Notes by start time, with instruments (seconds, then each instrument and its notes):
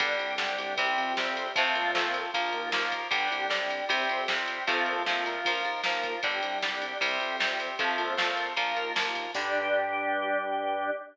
0.00 synth bass 1 G1, overdriven guitar D3 G3, drawbar organ D4 G4, kick, ride
0.19 synth bass 1 C2, ride
0.38 overdriven guitar D3 G3, drawbar organ D4 G4, snare
0.58 synth bass 1 C2, ride
0.77 overdriven guitar C3 G3, drawbar organ C4 G4, kick, ride
0.97 synth bass 1 F2, ride
1.17 overdriven guitar C3 G3, drawbar organ C4 G4, snare
1.37 ride
1.56 synth bass 1 F2, overdriven guitar C3 F3 A3, drawbar organ C4 F4 A4, kick, ride
1.75 synth bass 1 A#2, ride
1.95 overdriven guitar C3 F3 A3, drawbar organ C4 F4 A4, snare
2.14 ride
2.34 synth bass 1 A#1, overdriven guitar F3 A#3, drawbar organ F4 A#4, kick, ride
2.53 synth bass 1 D#2, ride
2.72 overdriven guitar F3 A#3, drawbar organ F4 A#4, snare
2.92 kick, ride
3.11 synth bass 1 G1, overdriven guitar D3 G3, drawbar organ D4 G4, kick, ride
3.31 synth bass 1 C2, ride
3.50 overdriven guitar D3 G3, drawbar organ D4 G4, snare
3.70 ride
3.89 synth bass 1 C2, overdriven guitar C3 G3, drawbar organ C4 G4, kick, ride
4.09 synth bass 1 F2, ride
4.28 overdriven guitar C3 G3, drawbar organ C4 G4, snare
4.48 ride
4.67 synth bass 1 F2, overdriven guitar C3 F3 A3, drawbar organ C4 F4 A4, kick, ride
4.86 synth bass 1 A#2, ride
5.06 overdriven guitar C3 F3 A3, drawbar organ C4 F4 A4, snare
5.26 drawbar organ F4 A#4, ride
5.45 synth bass 1 A#1, overdriven guitar F3 A#3, kick, ride
5.65 synth bass 1 D#2, ride
5.84 overdriven guitar F3 A#3, drawbar organ F4 A#4, snare
6.03 kick, ride
6.23 synth bass 1 G1, overdriven guitar D3 G3, drawbar organ D4 G4, kick, ride
6.43 synth bass 1 C2, ride
6.62 overdriven guitar D3 G3, drawbar organ D4 G4, snare
6.82 ride
7.01 synth bass 1 C2, overdriven guitar C3 G3, drawbar organ C4 G4, kick, ride
7.20 synth bass 1 F2, ride
7.40 overdriven guitar C3 G3, drawbar organ C4 G4, snare
7.60 ride
7.79 synth bass 1 F2, overdriven guitar C3 F3 A3, drawbar organ C4 F4 A4, kick, ride
7.98 synth bass 1 A#2, ride
8.18 overdriven guitar C3 F3 A3, drawbar organ C4 F4 A4, snare
8.37 ride
8.56 synth bass 1 A#1, overdriven guitar F3 A#3, drawbar organ F4 A#4, kick, ride
8.77 synth bass 1 D#2, ride
8.96 overdriven guitar F3 A#3, drawbar organ F4 A#4, snare
9.15 kick, ride
9.34 synth bass 1 G2, overdriven guitar D3 G3, drawbar organ D4 G4, kick, crash